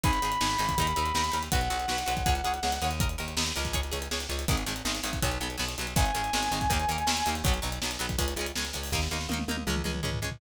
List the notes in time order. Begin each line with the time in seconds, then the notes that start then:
0.03 G#1 D#4 G#4 B5, kick, closed hi-hat
0.13 closed hi-hat
0.22 G#1 D#4 G#4, closed hi-hat
0.32 closed hi-hat
0.41 G#1 D#4 G#4, snare
0.50 closed hi-hat
0.58 G#1 D#4 G#4, closed hi-hat
0.69 kick, closed hi-hat
0.78 D#2 D#4 A#4, kick, closed hi-hat
0.87 closed hi-hat
0.96 D#2 D#4 A#4, closed hi-hat
1.06 closed hi-hat
1.14 D#2 D#4 A#4, snare
1.24 closed hi-hat
1.32 D#2 D#4 A#4, closed hi-hat
1.43 closed hi-hat
1.52 B1 F#4 B4 F#5, kick, closed hi-hat
1.61 closed hi-hat
1.70 B1 F#4 B4, closed hi-hat
1.80 closed hi-hat
1.88 B1 F#4 B4, snare
1.98 closed hi-hat
2.06 B1 F#4 B4, closed hi-hat
2.17 kick, closed hi-hat
2.26 C#2 G#4 C#5, kick, closed hi-hat
2.35 closed hi-hat
2.44 C#2 G#4 C#5, closed hi-hat
2.54 closed hi-hat
2.63 C#2 G#4 C#5, snare
2.72 closed hi-hat
2.82 D#2 G#4 C#5, closed hi-hat
2.91 closed hi-hat
3.00 A#4 D#5, kick, closed hi-hat
3.09 closed hi-hat
3.18 D#2 A#4 D#5, closed hi-hat
3.28 closed hi-hat
3.37 D#2 A#4 D#5, snare
3.46 closed hi-hat
3.56 C#2 A#4 D#5, closed hi-hat
3.65 kick, closed hi-hat
3.73 G#4 C#5, kick, closed hi-hat
3.83 closed hi-hat
3.92 C#2 G#4 C#5, closed hi-hat
4.02 closed hi-hat
4.11 C#2 G#4 C#5, snare
4.20 closed hi-hat
4.29 C#2 G#4 C#5, closed hi-hat
4.39 closed hi-hat
4.48 G#1 D#3 G#3, kick, closed hi-hat
4.57 closed hi-hat
4.66 G#1 D#3 G#3, closed hi-hat
4.76 closed hi-hat
4.85 G#1 D#3 G#3, snare
4.95 closed hi-hat
5.03 G#1 D#3 G#3, closed hi-hat
5.13 kick, closed hi-hat
5.22 B1 F#3 B3, kick, closed hi-hat
5.31 closed hi-hat
5.40 B1 F#3 B3, closed hi-hat
5.50 closed hi-hat
5.58 B1 F#3 B3, snare
5.69 closed hi-hat
5.78 B1 F#3 B3, closed hi-hat
5.87 closed hi-hat
5.96 G#1 D#3 G#3 G#5, kick, closed hi-hat
6.06 closed hi-hat
6.15 G#1 D#3 G#3, closed hi-hat
6.24 closed hi-hat
6.33 G#1 D#3 G#3, snare
6.43 closed hi-hat
6.51 G#1 D#3 G#3, closed hi-hat
6.61 kick, closed hi-hat
6.70 D#2 D#3 A#3, kick, closed hi-hat
6.80 closed hi-hat
6.88 D#2 D#3 A#3, closed hi-hat
6.98 closed hi-hat
7.07 D#2 D#3 A#3, snare
7.17 closed hi-hat
7.26 D#2 D#3 A#3, closed hi-hat
7.35 closed hi-hat
7.44 B1 F#3, kick, closed hi-hat
7.48 B3
7.54 closed hi-hat
7.62 B1 F#3 B3, closed hi-hat
7.72 closed hi-hat
7.82 B1 F#3 B3, snare
7.91 closed hi-hat
7.99 B1 F#3 B3, closed hi-hat
8.09 kick, closed hi-hat
8.18 C#2 G#3 C#4, kick, closed hi-hat
8.28 closed hi-hat
8.36 C#2 G#3, closed hi-hat
8.41 C#4
8.46 closed hi-hat
8.55 C#2 G#3 C#4, snare
8.65 closed hi-hat
8.73 C#2 G#3 C#4, closed hi-hat
8.83 open hi-hat
8.92 D#2 A#3 D#4, kick, snare
9.02 snare
9.11 D#2 A#3 D#4, snare
9.21 snare
9.29 D#2 A#3, high tom
9.33 D#4
9.39 high tom
9.48 D#2 A#3 D#4, high tom
9.57 high tom
9.67 C#2 G#3 C#4, mid tom
9.76 mid tom
9.84 C#2 G#3 C#4, mid tom
9.94 mid tom
10.03 C#2 G#3 C#4, floor tom
10.13 floor tom
10.22 C#2 G#3 C#4
10.32 floor tom